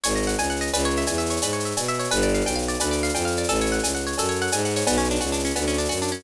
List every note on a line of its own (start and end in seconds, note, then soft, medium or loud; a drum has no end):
0.04 0.35 G#1 medium
0.04 0.69 C#5 medium
0.04 cowbell medium
0.04 shaker loud
0.10 shaker medium
0.15 0.61 D#5 medium
0.15 shaker medium
0.22 shaker medium
0.27 0.49 F#5 medium
0.27 shaker medium
0.33 shaker medium
0.38 0.70 C#2 medium
0.38 0.72 G#5 medium
0.38 cowbell medium
0.38 shaker medium
0.43 shaker medium
0.50 0.72 F#5 medium
0.50 shaker medium
0.56 shaker medium
0.61 0.72 D#5 medium
0.61 shaker medium
0.67 shaker medium
0.73 1.04 C#2 medium
0.73 1.43 B4 loud
0.73 cowbell medium
0.73 shaker loud
0.79 shaker medium
0.84 1.30 C#5 medium
0.84 shaker medium
0.90 shaker medium
0.96 1.18 E5 medium
0.96 shaker medium
1.01 shaker medium
1.07 1.39 E2 medium
1.07 1.77 G#5 medium
1.07 cowbell medium
1.07 shaker medium
1.13 shaker medium
1.18 1.65 E5 medium
1.18 shaker medium
1.26 shaker medium
1.30 1.52 C#5 medium
1.30 shaker medium
1.36 shaker medium
1.42 1.73 G#2 medium
1.42 2.09 B4 medium
1.42 cowbell medium
1.42 shaker loud
1.49 shaker medium
1.53 1.99 C#5 medium
1.53 shaker medium
1.60 shaker medium
1.65 1.88 E5 medium
1.65 shaker medium
1.71 shaker medium
1.77 2.08 B2 medium
1.77 2.10 G#5 medium
1.77 cowbell medium
1.77 shaker loud
1.83 shaker medium
1.88 2.10 E5 medium
1.88 shaker medium
1.94 shaker medium
1.99 2.10 C#5 medium
1.99 shaker medium
2.04 shaker medium
2.11 2.42 G1 loud
2.11 2.81 B4 loud
2.11 cowbell medium
2.11 shaker medium
2.16 shaker medium
2.22 2.68 D5 medium
2.22 shaker medium
2.29 shaker medium
2.34 2.55 F5 medium
2.34 shaker medium
2.41 shaker medium
2.45 2.76 B1 medium
2.45 3.14 G5 medium
2.45 cowbell medium
2.45 shaker medium
2.52 shaker medium
2.56 3.03 F5 medium
2.56 shaker medium
2.62 shaker medium
2.68 2.91 D5 medium
2.68 shaker medium
2.74 shaker medium
2.80 3.11 D2 medium
2.80 3.47 B4 medium
2.80 cowbell medium
2.80 shaker loud
2.86 shaker medium
2.91 3.37 D5 medium
2.91 shaker medium
2.98 shaker medium
3.03 3.25 F5 medium
3.03 shaker medium
3.09 shaker medium
3.14 3.45 F2 medium
3.14 3.48 G5 medium
3.14 cowbell medium
3.14 shaker medium
3.21 shaker medium
3.25 3.47 F5 medium
3.25 shaker medium
3.31 shaker medium
3.36 3.49 D5 medium
3.36 shaker medium
3.44 shaker medium
3.49 3.80 A1 medium
3.49 4.18 A4 loud
3.49 cowbell medium
3.49 shaker medium
3.55 shaker medium
3.60 4.06 C#5 medium
3.60 shaker medium
3.66 shaker medium
3.72 3.94 F#5 medium
3.72 shaker medium
3.79 shaker medium
3.83 4.14 C#2 medium
3.83 4.53 G#5 medium
3.83 cowbell medium
3.83 shaker loud
3.88 shaker medium
3.95 4.41 F#5 medium
3.95 shaker medium
4.00 shaker medium
4.07 4.28 C#5 medium
4.07 shaker medium
4.12 shaker medium
4.18 4.49 F#2 medium
4.18 4.84 A4 medium
4.18 cowbell medium
4.18 shaker loud
4.24 shaker medium
4.29 4.76 C#5 medium
4.29 shaker medium
4.35 shaker medium
4.41 4.65 F#5 medium
4.41 shaker medium
4.47 shaker medium
4.52 4.83 G#2 medium
4.52 4.86 G#5 medium
4.52 cowbell medium
4.52 shaker loud
4.58 shaker medium
4.65 4.87 F#5 medium
4.65 shaker medium
4.70 shaker medium
4.76 4.87 C#5 medium
4.76 shaker medium
4.81 shaker medium
4.87 5.18 B1 medium
4.87 4.98 B3 loud
4.87 cowbell loud
4.87 shaker loud
4.92 shaker medium
4.98 5.08 C#4 medium
4.98 shaker medium
5.04 shaker medium
5.10 5.21 D4 medium
5.10 shaker medium
5.15 shaker medium
5.20 5.52 C#2 medium
5.20 5.31 F#4 medium
5.20 cowbell medium
5.20 shaker medium
5.26 shaker medium
5.32 5.43 D4 medium
5.32 shaker medium
5.39 shaker medium
5.45 5.55 C#4 medium
5.45 shaker medium
5.50 shaker medium
5.56 5.87 D2 medium
5.56 5.66 B3 medium
5.56 cowbell medium
5.56 shaker medium
5.61 shaker medium
5.68 5.78 C#4 medium
5.68 shaker medium
5.73 shaker medium
5.78 5.89 D4 medium
5.78 shaker medium
5.85 shaker medium
5.89 6.21 F#2 medium
5.89 6.00 F#4 medium
5.89 cowbell medium
5.89 shaker medium
5.96 shaker medium
6.02 6.12 D4 medium
6.02 shaker medium
6.07 shaker medium
6.12 6.22 C#4 medium
6.12 shaker medium
6.19 shaker medium